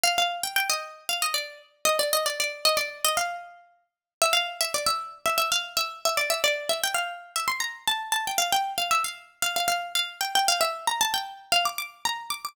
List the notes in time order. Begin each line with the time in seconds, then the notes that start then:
0.03 F5
0.18 F5
0.43 G5
0.56 G5
0.70 D#5
1.09 F5
1.22 D#5
1.34 D5
1.85 D#5
1.99 D5
2.13 D#5
2.26 D5
2.40 D5
2.65 D#5
2.77 D5
3.04 D#5
3.17 F5
4.22 E5
4.33 F5
4.61 E5
4.74 D5
4.86 E5
5.26 E5
5.38 E5
5.52 F5
5.77 E5
6.05 E5
6.17 D5
6.30 E5
6.44 D5
6.69 E5
6.83 G5
6.94 F5
7.36 E5
7.48 C6
7.60 A#5
7.87 A5
8.12 A5
8.27 G5
8.38 F5
8.52 G5
8.78 F5
8.91 E5
9.04 F5
9.42 F5
9.56 F5
9.68 F5
9.95 F5
10.21 G5
10.35 G5
10.48 F5
10.61 E5
10.87 A#5
11.01 A5
11.14 G5
11.52 F5
11.65 D6
11.78 D6
12.05 A#5
12.30 D6
12.45 D6